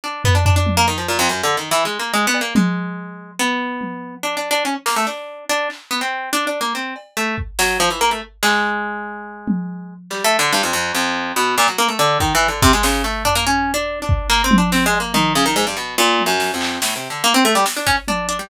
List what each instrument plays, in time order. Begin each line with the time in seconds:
0.04 orchestral harp D4
0.24 orchestral harp B3, floor tom
0.35 orchestral harp D4
0.45 orchestral harp D4, floor tom
0.56 orchestral harp D4
0.66 high tom
0.77 orchestral harp A#3
0.88 orchestral harp D#3
0.98 orchestral harp F3
1.08 orchestral harp A#2
1.19 orchestral harp F2
1.29 orchestral harp F#2
1.43 orchestral harp D3
1.57 orchestral harp D#3
1.71 orchestral harp E3, closed hi-hat
1.85 orchestral harp G#3
1.99 orchestral harp A#3
2.14 orchestral harp G#3
2.27 orchestral harp B3
2.34 cowbell
2.41 orchestral harp A#3
2.55 orchestral harp G#3, high tom
3.39 orchestral harp B3
3.81 high tom
4.23 orchestral harp D4
4.37 orchestral harp D4
4.51 orchestral harp D4
4.65 orchestral harp C#4
4.86 orchestral harp A#3, snare
4.96 orchestral harp A3
5.07 orchestral harp D4
5.49 orchestral harp D4
5.70 clap
5.91 orchestral harp B3
6.01 orchestral harp C4
6.33 orchestral harp D4
6.47 orchestral harp D4
6.61 orchestral harp A#3
6.75 orchestral harp C4
6.96 cowbell
7.17 orchestral harp A3
7.38 kick
7.59 orchestral harp F#3, snare
7.80 orchestral harp F3
7.90 orchestral harp E3
8.01 orchestral harp A#3
8.11 orchestral harp A3
8.43 orchestral harp G#3, clap
9.48 high tom
10.10 orchestral harp G3, clap
10.24 orchestral harp A3
10.39 orchestral harp D3
10.52 orchestral harp G2, closed hi-hat
10.63 orchestral harp F2
10.73 orchestral harp F2
10.95 orchestral harp F2
11.36 orchestral harp B2
11.57 orchestral harp A#2, clap
11.68 orchestral harp F#3
11.78 orchestral harp A#3
11.88 orchestral harp A3
11.99 orchestral harp D3
12.20 orchestral harp D#3, kick
12.35 orchestral harp E3
12.41 cowbell
12.48 orchestral harp D3
12.62 orchestral harp C3, kick
12.73 orchestral harp G#3
12.83 orchestral harp C#3, snare
13.04 orchestral harp A3
13.25 orchestral harp D4, floor tom
13.35 orchestral harp A#3
13.47 orchestral harp C#4
13.74 orchestral harp D4
14.02 orchestral harp D4
14.09 kick
14.30 orchestral harp A#3, clap
14.44 orchestral harp C4
14.51 high tom
14.58 orchestral harp D4
14.72 orchestral harp C4, snare
14.86 orchestral harp G#3
14.93 cowbell
15.00 orchestral harp A#3
15.14 orchestral harp D#3, high tom
15.35 orchestral harp C#3
15.46 orchestral harp D#3
15.56 orchestral harp G#2
15.67 orchestral harp G2
15.77 orchestral harp B2
15.98 orchestral harp A#2
16.19 high tom
16.26 orchestral harp F#2
16.40 snare
16.54 orchestral harp F2
16.61 clap
16.82 orchestral harp A2, snare
16.96 orchestral harp C3
17.10 orchestral harp D3
17.24 orchestral harp A#3
17.34 orchestral harp C4
17.45 orchestral harp A3
17.55 orchestral harp G3
17.66 snare
17.77 orchestral harp D4
17.87 orchestral harp C#4, kick
18.08 orchestral harp D4, high tom
18.29 orchestral harp D4, closed hi-hat
18.39 orchestral harp G3